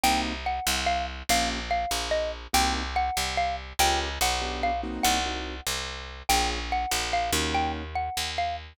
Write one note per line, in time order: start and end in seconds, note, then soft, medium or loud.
0.03 0.60 C2 medium
0.03 0.33 A#3 loud
0.03 0.33 C4 medium
0.03 0.33 D#4 loud
0.03 0.33 F#4 medium
0.03 0.21 G5 loud
0.46 0.83 F#5 medium
0.67 1.23 C2 medium
0.86 1.05 F5 medium
1.29 1.86 A#1 medium
1.29 1.59 A#3 medium
1.29 1.59 C#4 medium
1.29 1.59 F4 medium
1.29 1.59 G4 loud
1.29 1.49 F5 loud
1.71 2.08 F5 medium
1.91 2.47 A#1 medium
2.11 2.31 D#5 medium
2.53 3.10 C2 medium
2.53 2.82 A#3 medium
2.53 2.82 C4 medium
2.53 2.82 D#4 loud
2.53 2.82 F#4 medium
2.53 2.73 G5 medium
2.96 3.35 F#5 medium
3.17 3.73 C2 medium
3.37 3.56 F5 medium
3.79 4.19 C#2 medium
3.79 4.08 A#3 medium
3.79 4.08 C#4 medium
3.79 4.08 F4 loud
3.79 4.08 G4 medium
3.79 3.99 G5 loud
4.21 4.99 B1 medium
4.21 4.60 F#5 medium
4.41 4.71 B3 loud
4.41 4.71 D4 medium
4.41 4.71 F4 medium
4.41 4.71 G4 medium
4.63 4.81 F5 medium
4.83 5.19 A#3 medium
4.83 5.19 C4 medium
4.83 5.19 D#4 medium
4.83 5.19 F#4 loud
5.03 5.61 C2 medium
5.03 5.64 F#5 medium
5.26 5.55 A#3 medium
5.26 5.55 C4 medium
5.26 5.55 D#4 medium
5.26 5.55 F#4 medium
5.66 6.23 C2 medium
6.29 6.86 A#1 medium
6.29 6.59 A#3 medium
6.29 6.59 C#4 medium
6.29 6.59 F4 medium
6.29 6.59 G#4 medium
6.29 6.49 G5 loud
6.72 7.12 F#5 medium
6.91 7.31 A#1 medium
7.13 7.31 F5 medium
7.32 8.10 D#2 medium
7.32 7.83 A#3 medium
7.32 7.83 C#4 medium
7.32 7.83 D#4 medium
7.32 7.83 F#4 medium
7.54 7.72 G5 medium
7.95 8.31 F#5 medium
8.17 8.73 D#2 medium
8.38 8.56 F5 medium